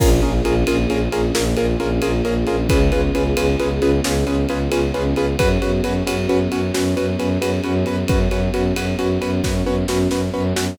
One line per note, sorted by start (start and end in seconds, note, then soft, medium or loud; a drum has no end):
0.00 0.20 A#1 loud
0.00 2.67 A#3 medium
0.00 0.09 C#4 loud
0.00 2.67 C#4 medium
0.00 0.09 F4 loud
0.00 2.67 F4 medium
0.00 0.09 G#4 loud
0.00 2.67 G#4 medium
0.00 0.09 A#4 loud
0.00 kick medium
0.00 crash medium
0.22 0.41 A#1 medium
0.22 0.31 C#4 medium
0.22 0.31 F4 medium
0.22 0.31 G#4 medium
0.22 0.31 A#4 medium
0.22 ride medium
0.45 0.64 A#1 medium
0.45 0.54 C#4 medium
0.45 0.54 F4 medium
0.45 0.54 G#4 medium
0.45 0.54 A#4 medium
0.45 ride medium
0.67 0.87 A#1 medium
0.67 0.77 C#4 medium
0.67 0.77 F4 medium
0.67 0.77 G#4 medium
0.67 0.77 A#4 medium
0.67 ride medium
0.89 1.08 A#1 medium
0.89 0.99 C#4 medium
0.89 0.99 F4 medium
0.89 0.99 G#4 medium
0.89 0.99 A#4 medium
0.89 ride medium
1.12 1.31 A#1 medium
1.12 1.21 C#4 medium
1.12 1.21 F4 medium
1.12 1.21 G#4 medium
1.12 1.21 A#4 medium
1.12 ride medium
1.35 1.55 A#1 medium
1.35 1.44 C#4 medium
1.35 1.44 F4 medium
1.35 1.44 G#4 medium
1.35 1.44 A#4 medium
1.35 snare medium
1.57 1.76 A#1 medium
1.57 1.66 C#4 medium
1.57 1.66 F4 medium
1.57 1.66 G#4 medium
1.57 1.66 A#4 loud
1.57 ride medium
1.80 2.00 A#1 medium
1.80 1.89 C#4 medium
1.80 1.89 F4 medium
1.80 1.89 G#4 medium
1.80 1.89 A#4 medium
1.80 ride medium
2.02 2.22 A#1 medium
2.02 2.11 C#4 medium
2.02 2.11 F4 medium
2.02 2.11 G#4 medium
2.02 2.11 A#4 medium
2.02 ride medium
2.25 2.44 A#1 medium
2.25 2.34 C#4 medium
2.25 2.34 F4 medium
2.25 2.34 G#4 medium
2.25 2.34 A#4 loud
2.25 ride medium
2.47 2.67 A#1 medium
2.47 2.56 C#4 medium
2.47 2.56 F4 loud
2.47 2.56 G#4 medium
2.47 2.56 A#4 medium
2.47 ride medium
2.69 2.90 C#2 loud
2.69 5.37 B3 medium
2.69 2.79 C#4 loud
2.69 5.37 C#4 medium
2.69 2.79 F4 medium
2.69 5.37 F4 medium
2.69 2.79 G#4 medium
2.69 5.37 G#4 medium
2.69 2.79 B4 medium
2.69 kick medium
2.69 ride medium
2.92 3.11 C#2 medium
2.92 3.01 C#4 medium
2.92 3.01 F4 medium
2.92 3.01 G#4 medium
2.92 3.01 B4 medium
2.92 ride medium
3.15 3.34 C#2 medium
3.15 3.24 C#4 medium
3.15 3.24 F4 medium
3.15 3.24 G#4 medium
3.15 3.24 B4 medium
3.15 ride medium
3.37 3.56 C#2 medium
3.37 3.46 C#4 medium
3.37 3.46 F4 medium
3.37 3.46 G#4 medium
3.37 3.46 B4 medium
3.37 ride medium
3.60 3.80 C#2 medium
3.60 3.69 C#4 loud
3.60 3.69 F4 medium
3.60 3.69 G#4 medium
3.60 3.69 B4 medium
3.60 ride medium
3.81 4.00 C#2 medium
3.81 3.91 C#4 medium
3.81 3.91 F4 medium
3.81 3.91 G#4 medium
3.81 3.91 B4 medium
3.81 ride medium
4.04 4.24 C#2 medium
4.04 4.13 C#4 medium
4.04 4.13 F4 medium
4.04 4.13 G#4 medium
4.04 4.13 B4 medium
4.04 snare medium
4.27 4.46 C#2 medium
4.27 4.36 C#4 medium
4.27 4.36 F4 medium
4.27 4.36 G#4 loud
4.27 4.36 B4 medium
4.27 ride medium
4.49 4.69 C#2 medium
4.49 4.59 C#4 medium
4.49 4.59 F4 medium
4.49 4.59 G#4 medium
4.49 4.59 B4 medium
4.49 ride medium
4.72 4.92 C#2 medium
4.72 4.81 C#4 medium
4.72 4.81 F4 medium
4.72 4.81 G#4 medium
4.72 4.81 B4 medium
4.72 ride medium
4.94 5.14 C#2 medium
4.94 5.03 C#4 medium
4.94 5.03 F4 medium
4.94 5.03 G#4 medium
4.94 5.03 B4 medium
4.94 ride medium
5.16 5.36 C#2 medium
5.16 5.26 C#4 medium
5.16 5.26 F4 medium
5.16 5.26 G#4 medium
5.16 5.26 B4 medium
5.16 ride medium
5.39 5.58 F#2 medium
5.39 10.73 B3 medium
5.39 5.48 C#4 medium
5.39 10.73 C#4 medium
5.39 5.48 F#4 loud
5.39 10.73 F#4 medium
5.39 5.48 B4 loud
5.39 kick medium
5.39 ride medium
5.62 5.81 F#2 medium
5.62 5.71 C#4 medium
5.62 5.71 F#4 medium
5.62 5.71 B4 medium
5.62 ride medium
5.83 6.03 F#2 medium
5.83 5.93 C#4 medium
5.83 5.93 F#4 loud
5.83 5.93 B4 medium
5.83 ride medium
6.07 6.27 F#2 medium
6.07 6.16 C#4 medium
6.07 6.16 F#4 medium
6.07 6.16 B4 medium
6.07 ride medium
6.29 6.48 F#2 medium
6.29 6.38 C#4 medium
6.29 6.38 F#4 loud
6.29 6.38 B4 medium
6.29 ride medium
6.52 6.71 F#2 medium
6.52 6.61 C#4 loud
6.52 6.61 F#4 medium
6.52 6.61 B4 medium
6.52 ride medium
6.74 6.95 F#2 medium
6.74 6.83 C#4 medium
6.74 6.83 F#4 medium
6.74 6.83 B4 medium
6.74 snare medium
6.97 7.16 F#2 medium
6.97 7.06 C#4 medium
6.97 7.06 F#4 medium
6.97 7.06 B4 medium
6.97 ride medium
7.19 7.38 F#2 medium
7.19 7.28 C#4 loud
7.19 7.28 F#4 medium
7.19 7.28 B4 medium
7.19 ride medium
7.41 7.60 F#2 medium
7.41 7.51 C#4 medium
7.41 7.51 F#4 medium
7.41 7.51 B4 medium
7.41 ride medium
7.64 7.84 F#2 medium
7.64 7.73 C#4 medium
7.64 7.73 F#4 medium
7.64 7.73 B4 medium
7.64 ride medium
7.85 8.04 F#2 medium
7.85 7.96 C#4 medium
7.85 7.96 F#4 medium
7.85 7.96 B4 loud
7.85 ride medium
8.08 8.28 F#2 medium
8.08 8.18 C#4 medium
8.08 8.18 F#4 medium
8.08 8.18 B4 medium
8.08 kick medium
8.08 ride medium
8.30 8.49 F#2 medium
8.30 8.40 C#4 medium
8.30 8.40 F#4 medium
8.30 8.40 B4 medium
8.30 ride medium
8.53 8.73 F#2 medium
8.53 8.63 C#4 medium
8.53 8.63 F#4 medium
8.53 8.63 B4 medium
8.53 ride medium
8.76 8.95 F#2 medium
8.76 8.85 C#4 medium
8.76 8.85 F#4 medium
8.76 8.85 B4 medium
8.76 ride medium
8.99 9.18 F#2 medium
8.99 9.08 C#4 medium
8.99 9.08 F#4 medium
8.99 9.08 B4 medium
8.99 ride medium
9.21 9.41 F#2 medium
9.21 9.30 C#4 medium
9.21 9.30 F#4 medium
9.21 9.30 B4 loud
9.21 ride medium
9.43 9.63 F#2 medium
9.43 9.53 C#4 medium
9.43 9.53 F#4 medium
9.43 9.53 B4 medium
9.43 kick medium
9.43 snare medium
9.65 9.84 F#2 medium
9.65 9.75 C#4 medium
9.65 9.75 F#4 medium
9.65 9.75 B4 medium
9.65 high tom medium
9.88 10.08 F#2 medium
9.88 9.98 C#4 medium
9.88 9.98 F#4 medium
9.88 9.98 B4 medium
9.88 snare medium
10.11 10.30 F#2 medium
10.11 10.20 C#4 medium
10.11 10.20 F#4 medium
10.11 10.20 B4 medium
10.11 snare medium
10.34 10.53 F#2 medium
10.34 10.43 C#4 medium
10.34 10.43 F#4 medium
10.34 10.43 B4 medium
10.56 10.75 F#2 medium
10.56 10.65 C#4 medium
10.56 10.65 F#4 loud
10.56 10.65 B4 medium
10.56 snare medium